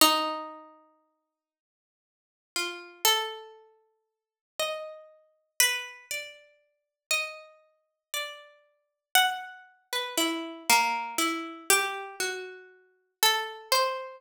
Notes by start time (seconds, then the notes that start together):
0.01 D#4
2.56 F4
3.05 A4
4.60 D#5
5.60 B4
6.11 D5
7.11 D#5
8.14 D5
9.15 F#5
9.93 B4
10.18 E4
10.69 A#3
11.18 E4
11.70 G4
12.20 F#4
13.23 A4
13.72 C5